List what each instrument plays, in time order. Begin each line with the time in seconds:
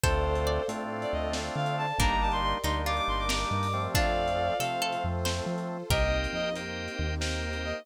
0.03 synth bass 1 D2, drawbar organ A3 C4 D4 F4, harpsichord A4 C5, pad 5 (bowed) A4 C5 D5 F5, violin A4 C5, kick, closed hi-hat
0.35 closed hi-hat
0.47 harpsichord D5
0.68 synth bass 1 A2, drawbar organ A3 C4 D4 F4, closed hi-hat
1.01 violin D5, closed hi-hat
1.12 synth bass 1 D2, violin D#5
1.33 snare
1.56 synth bass 1 D3, violin F5
1.66 closed hi-hat
1.77 violin A5
1.98 synth bass 1 G1, drawbar organ G3 A#3 D4 D#4, harpsichord A#3 D4, pad 5 (bowed) G4 A#4 D5 D#5, violin A#5, kick, closed hi-hat
2.10 violin A#5
2.21 violin A5
2.32 violin C6, closed hi-hat
2.43 violin C6
2.64 synth bass 1 D2, drawbar organ G3 A#3 D4 D#4, harpsichord D#4, violin C6, closed hi-hat
2.86 harpsichord F4, violin D6
2.97 violin D6, closed hi-hat
3.08 synth bass 1 G1, violin C6
3.19 violin D6
3.29 harpsichord A#4, violin D6, snare
3.51 synth bass 1 G2
3.63 open hi-hat
3.73 drawbar organ F3 A3 C4
3.94 synth bass 1 F2, harpsichord D4 F4, pad 5 (bowed) F4 A4 C5, violin D5 F5, kick, closed hi-hat
4.28 closed hi-hat
4.60 synth bass 1 C3, drawbar organ F3 A3 C4, harpsichord A4, violin F5, closed hi-hat
4.82 harpsichord A4
4.92 closed hi-hat
5.04 synth bass 1 F2
5.25 harpsichord C5, snare
5.46 synth bass 1 F3
5.58 closed hi-hat
5.90 synth bass 1 C2, pad 5 (bowed) A#3 C4 D#4 G4, harpsichord G4 A#4, drawbar organ A#4 C5 D#5 G5, violin D#5, kick, closed hi-hat
6.24 closed hi-hat
6.33 synth bass 1 F2, violin D#5
6.56 drawbar organ A#4 C5 D#5 G5, closed hi-hat
6.88 closed hi-hat
6.99 synth bass 1 D#2
7.21 drawbar organ A#4 C5 D#5 G5, snare
7.53 closed hi-hat
7.65 violin D#5